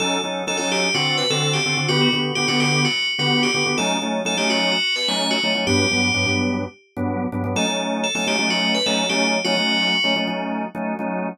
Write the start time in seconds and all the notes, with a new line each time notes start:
0.00 F#3 C#4 D#4 A4
0.24 F#3 C#4 D#4 A4
0.47 F#3 C#4 D#4 A4
0.57 F#3 C#4 D#4 A4
0.72 G4
0.94 D3 C4 F#4 A4
1.18 B4
1.30 D3 C4 F#4 A4
1.53 G4
1.65 D3 C4 F#4 A4
1.77 D3 C4 F#4 A4
1.88 D3 B3 F#4 G4
2.01 F#4
2.13 D3 B3 F#4 G4
2.35 D3 B3 F#4 G4
2.48 D3 B3 F#4 G4
2.60 G4
2.85 F#4
3.19 D3 B3 F#4 G4
3.43 G4
3.54 D3 B3 F#4 G4
3.66 D3 B3 F#4 G4
3.78 F#3 A3 C#4 D#4 A4
4.02 F#3 A3 C#4 D#4
4.25 F#3 A3 C#4 D#4 A4
4.37 F#3 A3 C#4 D#4 G4
4.50 F#4
4.72 F#4
4.96 B4
5.08 F#3 A3 C#4 D#4 C#5
5.31 F#4
5.43 F#3 A3 C#4 D#4
5.55 F#3 A3 C#4 D#4
5.67 G2 F#3 B3 D4 G4
5.91 G2 F#3 B3 D4
6.14 G2 F#3 B3 D4
6.26 G2 F#3 B3 D4
6.97 G2 F#3 B3 D4
7.32 G2 F#3 B3 D4
7.44 G2 F#3 B3 D4
7.56 F#3 A3 C#4 D#4 A4
7.68 F#3 A3 C#4 D#4
8.04 A4
8.15 F#3 A3 C#4 D#4 A4
8.27 F#3 A3 C#4 D#4 G4
8.39 F#3 A3 C#4 D#4
8.50 F#4
8.75 B4
8.86 F#3 A3 C#4 D#4 A4
9.09 F#3 A3 C#4 D#4 G4
9.45 F#3 A3 C#4 D#4 F#4
9.57 F#3 A3 C#4 D#4
10.04 F#3 A3 C#4 D#4
10.16 F#3 A3 C#4 D#4
10.27 F#3 A3 C#4 D#4
10.75 F#3 A3 C#4 D#4
10.99 F#3 A3 C#4 D#4